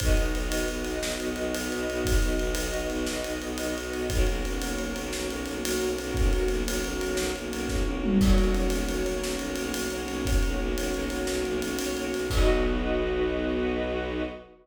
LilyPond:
<<
  \new Staff \with { instrumentName = "String Ensemble 1" } { \time 12/8 \key b \major \tempo 4. = 117 <b dis' fis'>1.~ | <b dis' fis'>1. | <ais cis' fis'>1.~ | <ais cis' fis'>1. |
<ais cis' fis'>1.~ | <ais cis' fis'>1. | <b dis' fis'>1. | }
  \new Staff \with { instrumentName = "String Ensemble 1" } { \time 12/8 \key b \major <fis' b' dis''>1.~ | <fis' b' dis''>1. | <fis' ais' cis''>1.~ | <fis' ais' cis''>1. |
<fis' ais' cis''>1.~ | <fis' ais' cis''>1. | <fis' b' dis''>1. | }
  \new Staff \with { instrumentName = "Violin" } { \clef bass \time 12/8 \key b \major b,,8 b,,8 b,,8 b,,8 b,,8 b,,8 b,,8 b,,8 b,,8 b,,8 b,,8 b,,8 | b,,8 b,,8 b,,8 b,,8 b,,8 b,,8 b,,8 b,,8 b,,8 b,,8 b,,8 b,,8 | b,,8 b,,8 b,,8 b,,8 b,,8 b,,8 b,,8 b,,8 b,,8 b,,8 b,,8 b,,8 | b,,8 b,,8 b,,8 b,,8 b,,8 b,,8 b,,8 b,,8 b,,8 b,,8 b,,8 b,,8 |
b,,8 b,,8 b,,8 b,,8 b,,8 b,,8 b,,8 b,,8 b,,8 b,,8 b,,8 b,,8 | b,,8 b,,8 b,,8 b,,8 b,,8 b,,8 b,,8 b,,8 b,,8 b,,8 b,,8 b,,8 | b,,1. | }
  \new DrumStaff \with { instrumentName = "Drums" } \drummode { \time 12/8 <bd cymr>8 cymr8 cymr8 cymr8 cymr8 cymr8 sn8 cymr8 cymr8 cymr8 cymr8 cymr8 | <bd cymr>8 cymr8 cymr8 cymr8 cymr8 cymr8 sn8 cymr8 cymr8 cymr8 cymr8 cymr8 | <bd cymr>8 cymr8 cymr8 cymr8 cymr8 cymr8 sn8 cymr8 cymr8 cymr8 cymr8 cymr8 | <bd cymr>8 cymr8 cymr8 cymr8 cymr8 cymr8 sn8 cymr8 cymr8 <bd sn>8 tommh8 toml8 |
<cymc bd>8 cymr8 cymr8 cymr8 cymr8 cymr8 sn8 cymr8 cymr8 cymr8 cymr8 cymr8 | <bd cymr>8 cymr4 cymr8 cymr8 cymr8 sn8 cymr8 cymr8 cymr8 cymr8 cymr8 | <cymc bd>4. r4. r4. r4. | }
>>